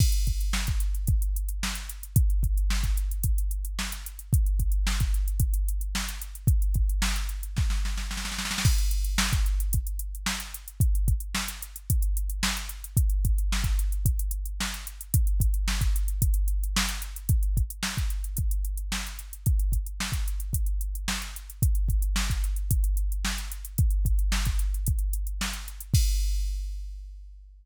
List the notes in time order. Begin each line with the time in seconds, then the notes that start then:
0.00 kick, crash
0.12 closed hi-hat
0.27 kick, closed hi-hat
0.41 closed hi-hat
0.53 snare
0.67 kick, closed hi-hat
0.80 closed hi-hat
0.95 closed hi-hat
1.07 kick, closed hi-hat
1.22 closed hi-hat
1.36 closed hi-hat
1.49 closed hi-hat
1.63 snare
1.75 closed hi-hat
1.89 closed hi-hat
2.03 closed hi-hat
2.16 kick, closed hi-hat
2.30 closed hi-hat
2.43 kick, closed hi-hat
2.58 closed hi-hat
2.70 snare
2.83 kick, closed hi-hat
2.97 closed hi-hat
3.11 closed hi-hat
3.24 kick, closed hi-hat
3.38 closed hi-hat
3.51 closed hi-hat
3.65 closed hi-hat
3.79 snare
3.92 closed hi-hat
4.06 closed hi-hat
4.19 closed hi-hat
4.33 kick, closed hi-hat
4.46 closed hi-hat
4.60 kick, closed hi-hat
4.72 closed hi-hat
4.87 snare
5.00 kick, closed hi-hat
5.14 closed hi-hat
5.28 closed hi-hat
5.40 kick, closed hi-hat
5.54 closed hi-hat
5.68 closed hi-hat
5.81 closed hi-hat
5.95 snare
6.09 closed hi-hat
6.22 closed hi-hat
6.35 closed hi-hat
6.47 kick, closed hi-hat
6.62 closed hi-hat
6.74 kick, closed hi-hat
6.89 closed hi-hat
7.02 snare
7.16 closed hi-hat
7.29 closed hi-hat
7.43 closed hi-hat
7.57 kick, snare
7.70 snare
7.85 snare
7.97 snare
8.11 snare
8.17 snare
8.25 snare
8.32 snare
8.39 snare
8.45 snare
8.51 snare
8.58 snare
8.65 kick, crash
8.78 closed hi-hat
8.91 closed hi-hat
9.05 closed hi-hat
9.18 snare
9.33 kick, closed hi-hat
9.46 closed hi-hat
9.60 closed hi-hat
9.73 kick, closed hi-hat
9.87 closed hi-hat
9.99 closed hi-hat
10.15 closed hi-hat
10.26 snare
10.40 closed hi-hat
10.54 closed hi-hat
10.68 closed hi-hat
10.80 kick, closed hi-hat
10.95 closed hi-hat
11.08 kick, closed hi-hat
11.20 closed hi-hat
11.35 snare
11.48 closed hi-hat
11.62 closed hi-hat
11.76 closed hi-hat
11.90 kick, closed hi-hat
12.02 closed hi-hat
12.17 closed hi-hat
12.30 closed hi-hat
12.43 snare
12.57 closed hi-hat
12.69 closed hi-hat
12.84 closed hi-hat
12.97 kick, closed hi-hat
13.10 closed hi-hat
13.25 kick, closed hi-hat
13.38 closed hi-hat
13.52 snare
13.64 kick, closed hi-hat
13.79 closed hi-hat
13.92 closed hi-hat
14.06 kick, closed hi-hat
14.19 closed hi-hat
14.31 closed hi-hat
14.45 closed hi-hat
14.60 snare
14.74 closed hi-hat
14.87 closed hi-hat
15.01 closed hi-hat
15.14 kick, closed hi-hat
15.27 closed hi-hat
15.40 kick, closed hi-hat
15.54 closed hi-hat
15.68 snare
15.81 kick, closed hi-hat
15.96 closed hi-hat
16.08 closed hi-hat
16.22 kick, closed hi-hat
16.34 closed hi-hat
16.48 closed hi-hat
16.64 closed hi-hat
16.76 snare
16.89 closed hi-hat
17.02 closed hi-hat
17.16 closed hi-hat
17.29 kick, closed hi-hat
17.43 closed hi-hat
17.57 kick, closed hi-hat
17.70 closed hi-hat
17.83 snare
17.97 kick, closed hi-hat
18.10 closed hi-hat
18.24 closed hi-hat
18.37 kick, closed hi-hat
18.51 closed hi-hat
18.65 closed hi-hat
18.77 closed hi-hat
18.92 snare
19.07 closed hi-hat
19.19 closed hi-hat
19.33 closed hi-hat
19.46 kick, closed hi-hat
19.59 closed hi-hat
19.72 kick, closed hi-hat
19.86 closed hi-hat
20.00 snare
20.12 kick, closed hi-hat
20.28 closed hi-hat
20.40 closed hi-hat
20.53 kick, closed hi-hat
20.66 closed hi-hat
20.81 closed hi-hat
20.95 closed hi-hat
21.08 snare
21.22 closed hi-hat
21.36 closed hi-hat
21.50 closed hi-hat
21.62 kick, closed hi-hat
21.75 closed hi-hat
21.89 kick, closed hi-hat
22.02 closed hi-hat
22.16 snare
22.30 kick, closed hi-hat
22.44 closed hi-hat
22.56 closed hi-hat
22.71 kick, closed hi-hat
22.84 closed hi-hat
22.97 closed hi-hat
23.12 closed hi-hat
23.25 snare
23.38 closed hi-hat
23.52 closed hi-hat
23.65 closed hi-hat
23.78 kick, closed hi-hat
23.91 closed hi-hat
24.05 kick, closed hi-hat
24.19 closed hi-hat
24.32 snare
24.45 kick, closed hi-hat
24.59 closed hi-hat
24.74 closed hi-hat
24.86 kick, closed hi-hat
24.99 closed hi-hat
25.13 closed hi-hat
25.27 closed hi-hat
25.41 snare
25.53 closed hi-hat
25.68 closed hi-hat
25.81 closed hi-hat
25.94 kick, crash